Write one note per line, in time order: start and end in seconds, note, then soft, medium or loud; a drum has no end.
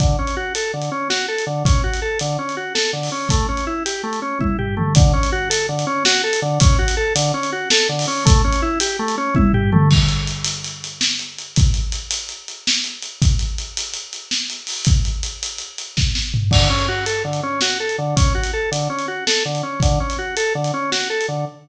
0.00 0.16 D3 medium
0.00 kick loud
0.00 closed hi-hat loud
0.19 0.35 C#4 medium
0.27 closed hi-hat medium
0.37 0.53 F#4 medium
0.55 0.72 A4 medium
0.55 closed hi-hat loud
0.74 0.90 D3 medium
0.81 closed hi-hat medium
0.92 1.08 C#4 medium
1.10 1.26 F#4 medium
1.10 snare loud
1.28 1.45 A4 medium
1.38 closed hi-hat medium
1.47 1.63 D3 medium
1.65 1.82 C#4 medium
1.65 kick loud
1.65 closed hi-hat loud
1.84 2.00 F#4 medium
1.93 closed hi-hat medium
2.02 2.18 A4 medium
2.19 2.37 D3 medium
2.19 closed hi-hat loud
2.39 2.55 C#4 medium
2.49 closed hi-hat medium
2.57 2.73 F#4 medium
2.75 2.91 A4 medium
2.75 snare loud
2.93 3.10 D3 medium
3.03 open hi-hat medium
3.12 3.28 C#4 medium
3.29 3.47 A3 medium
3.29 kick loud
3.29 closed hi-hat loud
3.49 3.65 C#4 medium
3.57 closed hi-hat medium
3.67 3.83 E4 medium
3.86 4.02 G4 medium
3.86 closed hi-hat loud
4.03 4.20 A3 medium
4.13 closed hi-hat medium
4.22 4.38 C#4 medium
4.39 4.57 E4 medium
4.39 kick medium
4.39 high tom medium
4.59 4.75 G4 medium
4.59 floor tom medium
4.77 4.93 A3 medium
4.77 mid tom loud
4.95 5.12 D3 medium
4.95 kick loud
4.95 closed hi-hat loud
5.13 5.30 C#4 medium
5.23 closed hi-hat medium
5.32 5.49 F#4 medium
5.50 5.66 A4 medium
5.50 closed hi-hat loud
5.69 5.85 D3 medium
5.79 closed hi-hat medium
5.87 6.03 C#4 medium
6.05 6.22 F#4 medium
6.05 snare loud
6.24 6.40 A4 medium
6.33 closed hi-hat loud
6.42 6.59 D3 medium
6.60 6.77 C#4 medium
6.60 kick loud
6.60 closed hi-hat loud
6.79 6.95 F#4 medium
6.88 closed hi-hat loud
6.97 7.13 A4 medium
7.15 7.32 D3 medium
7.15 closed hi-hat loud
7.34 7.50 C#4 medium
7.43 closed hi-hat medium
7.52 7.69 F#4 medium
7.70 7.88 A4 medium
7.70 snare loud
7.89 8.06 D3 medium
7.99 open hi-hat loud
8.07 8.24 C#4 medium
8.25 8.42 A3 medium
8.25 kick loud
8.25 closed hi-hat loud
8.44 8.61 C#4 medium
8.52 closed hi-hat medium
8.62 8.79 E4 medium
8.80 8.97 G4 medium
8.80 closed hi-hat loud
8.99 9.16 A3 medium
9.08 closed hi-hat medium
9.18 9.34 C#4 medium
9.35 9.52 E4 medium
9.35 kick loud
9.35 high tom loud
9.53 9.70 G4 medium
9.53 floor tom loud
9.72 9.89 A3 medium
9.72 mid tom loud
9.91 kick loud
9.91 crash loud
10.08 closed hi-hat medium
10.27 closed hi-hat loud
10.44 closed hi-hat loud
10.64 closed hi-hat loud
10.84 closed hi-hat medium
11.01 snare loud
11.19 closed hi-hat medium
11.38 closed hi-hat medium
11.56 kick loud
11.56 closed hi-hat loud
11.74 closed hi-hat medium
11.92 closed hi-hat loud
12.11 closed hi-hat loud
12.29 closed hi-hat medium
12.48 closed hi-hat medium
12.67 snare loud
12.84 closed hi-hat medium
13.02 closed hi-hat medium
13.22 kick loud
13.22 closed hi-hat loud
13.39 closed hi-hat medium
13.58 closed hi-hat medium
13.77 closed hi-hat loud
13.93 closed hi-hat loud
14.13 closed hi-hat medium
14.31 snare loud
14.50 closed hi-hat medium
14.67 open hi-hat medium
14.85 kick loud
14.85 closed hi-hat loud
15.05 closed hi-hat medium
15.23 closed hi-hat loud
15.43 closed hi-hat loud
15.58 closed hi-hat medium
15.78 closed hi-hat loud
15.97 kick loud
15.97 snare loud
16.15 snare loud
16.34 floor tom loud
16.51 16.68 D3 medium
16.51 kick loud
16.51 crash loud
16.70 16.86 C#4 medium
16.79 closed hi-hat medium
16.88 17.05 F#4 medium
17.06 17.23 A4 medium
17.06 closed hi-hat loud
17.24 17.41 D3 medium
17.33 closed hi-hat medium
17.43 17.60 C#4 medium
17.61 17.78 F#4 medium
17.61 snare loud
17.80 17.97 A4 medium
17.89 closed hi-hat medium
17.98 18.15 D3 medium
18.16 18.33 C#4 medium
18.16 kick loud
18.16 closed hi-hat loud
18.35 18.51 F#4 medium
18.43 closed hi-hat medium
18.53 18.70 A4 medium
18.72 18.88 D3 medium
18.72 closed hi-hat loud
18.90 19.06 C#4 medium
18.99 closed hi-hat medium
19.08 19.24 F#4 medium
19.27 19.43 A4 medium
19.27 snare loud
19.45 19.62 D3 medium
19.55 closed hi-hat medium
19.63 19.80 C#4 medium
19.80 19.99 D3 medium
19.80 kick loud
19.80 closed hi-hat loud
20.00 20.17 C#4 medium
20.10 closed hi-hat medium
20.18 20.35 F#4 medium
20.37 20.53 A4 medium
20.37 closed hi-hat loud
20.55 20.72 D3 medium
20.64 closed hi-hat medium
20.74 20.90 C#4 medium
20.92 21.08 F#4 medium
20.92 snare loud
21.10 21.26 A4 medium
21.21 closed hi-hat medium
21.28 21.45 D3 medium